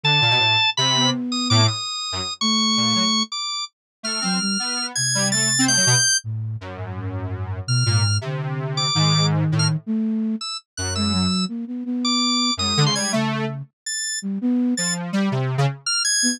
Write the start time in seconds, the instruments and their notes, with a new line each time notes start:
0.03 lead 1 (square) D3, drawbar organ A5
0.21 lead 1 (square) A#2
0.30 lead 1 (square) B2
0.40 lead 1 (square) A2
0.77 lead 1 (square) C3, drawbar organ B5
0.96 flute B3
1.32 drawbar organ D#6
1.50 lead 1 (square) A2, drawbar organ D6
1.68 drawbar organ D#6
2.12 lead 1 (square) F#2
2.41 flute A3, drawbar organ C#6
2.77 lead 1 (square) A#2
2.95 lead 1 (square) F#3
3.32 drawbar organ D6
4.03 lead 1 (square) A3, drawbar organ F6
4.21 flute F#3, lead 1 (square) C4
4.41 flute G3
4.59 lead 1 (square) B3
4.95 flute C3, drawbar organ G#6
5.15 lead 1 (square) G3
5.32 lead 1 (square) A3, drawbar organ A6
5.59 lead 1 (square) C4
5.68 lead 1 (square) A3, drawbar organ G6
5.77 lead 1 (square) F#3
5.87 lead 1 (square) B2
6.24 flute A2
6.61 lead 1 (square) F#2
6.76 flute G#2
6.95 flute G#2
7.67 flute B2, drawbar organ F6
7.86 flute G#2, lead 1 (square) A#2
8.21 lead 1 (square) C3, flute D3
8.77 drawbar organ D6
8.95 lead 1 (square) G#2, flute D#3
9.52 lead 1 (square) A2
9.59 drawbar organ F6
9.86 flute A3
10.41 drawbar organ E6
10.77 lead 1 (square) F#2, drawbar organ F#6
10.95 flute G#3, drawbar organ E6
11.13 flute F#3
11.48 flute A#3
11.67 flute B3
11.85 flute B3
12.05 drawbar organ D6
12.57 lead 1 (square) F#2, flute G#3, drawbar organ D#6
12.77 lead 1 (square) D3
12.86 lead 1 (square) C#3, drawbar organ C6
12.95 lead 1 (square) G3, drawbar organ G#6
13.12 flute C#3, lead 1 (square) A3
13.86 drawbar organ A6
14.22 flute G3
14.41 flute B3
14.77 lead 1 (square) F3, drawbar organ A6
15.13 lead 1 (square) G3
15.32 lead 1 (square) C3
15.58 lead 1 (square) C#3
15.86 drawbar organ F6
16.05 drawbar organ G#6
16.23 flute B3